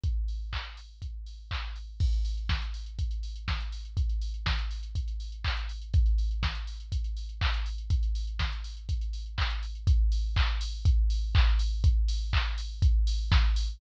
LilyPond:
\new DrumStaff \drummode { \time 4/4 \tempo 4 = 122 <hh bd>8 hho8 <hc bd>8 hho8 <hh bd>8 hho8 <hc bd>8 hho8 | <cymc bd>16 hh16 hho16 hh16 <bd sn>16 hh16 hho16 hh16 <hh bd>16 hh16 hho16 hh16 <bd sn>16 hh16 hho16 hh16 | <hh bd>16 hh16 hho16 hh16 <bd sn>16 hh16 hho16 hh16 <hh bd>16 hh16 hho16 hh16 <hc bd>16 hh16 hho16 hh16 | <hh bd>16 hh16 hho16 hh16 <bd sn>16 hh16 hho16 hh16 <hh bd>16 hh16 hho16 hh16 <hc bd>16 hh16 hho16 hh16 |
<hh bd>16 hh16 hho16 hh16 <bd sn>16 hh16 hho16 hh16 <hh bd>16 hh16 hho16 hh16 <hc bd>16 hh16 hho16 hh16 | <hh bd>8 hho8 <hc bd>8 hho8 <hh bd>8 hho8 <hc bd>8 hho8 | <hh bd>8 hho8 <hc bd>8 hho8 <hh bd>8 hho8 <bd sn>8 hho8 | }